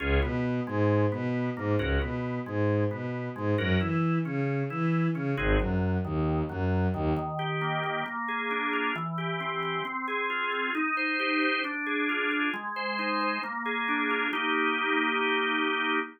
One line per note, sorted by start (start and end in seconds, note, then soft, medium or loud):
0.00 0.19 C#2 loud
0.00 0.20 C#4 medium
0.00 0.20 F4 medium
0.00 0.20 G#4 medium
0.22 0.60 B2 medium
0.22 0.60 B3 medium
0.67 1.05 G#2 medium
0.67 1.05 G#3 medium
1.12 1.50 B2 medium
1.12 1.50 B3 medium
1.57 1.76 G#2 medium
1.57 1.76 A#3 medium
1.79 1.98 C#2 medium
1.79 1.99 C#4 medium
1.79 1.99 F#4 medium
1.79 1.99 A#4 medium
2.01 2.39 B2 medium
2.01 2.40 B3 medium
2.46 2.84 G#2 medium
2.46 2.84 G#3 medium
2.91 3.29 B2 medium
2.91 3.29 B3 medium
3.36 3.55 G#2 medium
3.36 3.55 G#3 medium
3.58 3.77 F#2 medium
3.58 3.78 C#4 medium
3.58 3.78 F#4 medium
3.58 3.78 A#4 medium
3.81 4.19 E3 medium
3.81 4.19 E4 medium
4.25 4.63 C#3 medium
4.25 4.63 C#4 medium
4.70 5.08 E3 medium
4.70 5.08 E4 medium
5.15 5.34 C#3 medium
5.15 5.34 C#4 medium
5.37 5.56 G#1 loud
5.37 5.58 C4 medium
5.37 5.58 D#4 medium
5.37 5.58 F#4 medium
5.37 5.58 G#4 medium
5.60 5.98 F#2 medium
5.60 5.98 F#3 medium
6.04 6.43 D#2 medium
6.04 6.43 D#3 medium
6.49 6.87 F#2 medium
6.49 6.87 F#3 medium
6.94 7.13 D#2 medium
6.94 7.13 D#3 medium
7.17 8.02 D#3 loud
7.39 7.83 G4 medium
7.61 8.04 A#3 medium
7.84 8.05 G4 medium
8.06 8.91 A#3 loud
8.28 8.92 G#4 medium
8.51 8.93 D4 medium
8.73 8.94 F4 medium
8.96 9.81 E3 loud
9.18 9.62 G4 medium
9.40 9.83 C4 medium
9.63 9.84 G4 medium
9.85 10.70 C4 loud
10.08 10.52 G#4 medium
10.30 10.72 F4 medium
10.52 10.74 G#4 medium
10.75 11.60 D#4 loud
10.97 11.41 C5 medium
11.19 11.62 G4 medium
11.42 11.63 C5 medium
11.64 12.49 D4 medium
11.86 12.31 G#4 medium
12.09 12.51 F4 medium
12.31 12.53 G#4 medium
12.54 13.39 G#3 loud
12.76 13.20 C5 medium
12.99 13.41 D#4 medium
13.21 13.42 C5 medium
13.43 14.28 A#3 medium
13.66 14.29 G#4 medium
13.88 14.31 D4 medium
14.10 14.32 F4 medium
14.33 16.00 A#3 loud
14.33 16.00 D#4 loud
14.33 16.00 G4 loud